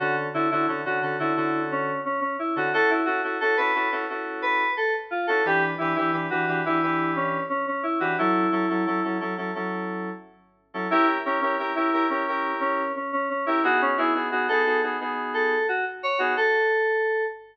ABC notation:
X:1
M:4/4
L:1/16
Q:1/4=88
K:Amix
V:1 name="Electric Piano 2"
F z E E z F2 E3 C2 C C E F | A E F z A B2 z3 B2 A z =F A | G z E E z F2 E3 C2 C C E F | E6 z10 |
E z C C z E2 C3 C2 C C C E | F C E z F A2 z3 A2 F z c F | A6 z10 |]
V:2 name="Electric Piano 2"
[D,CA]2 [D,CFA] [D,CFA] [D,CFA] [D,CA] [D,CFA] [D,CFA] [D,CFA]7 [D,CA] | [CEF]2 [CEA] [CEFA] [CEF] [CEFA] [CEFA] [CEFA] [CEFA]7 [CEF] | [E,DB]2 [E,DGB] [E,DGB] [E,DGB] [E,DGB] [E,DGB] [E,DGB] [E,DGB]7 [E,DGB] | [F,CA]2 [F,CEA] [F,CEA] [F,CEA] [F,CEA] [F,CEA] [F,CEA] [F,CEA]7 [F,CEA] |
[CG_B]2 [EGB] [EGB] [CEGB] [CGB] [CEGB] [EGB] [CEGB]7 [CGB] | [B,^D^G]2 [B,DFG] [B,DFG] [B,DG] [B,DFG] [B,DFG] [B,DFG] [B,DFG]7 [B,DG] | z16 |]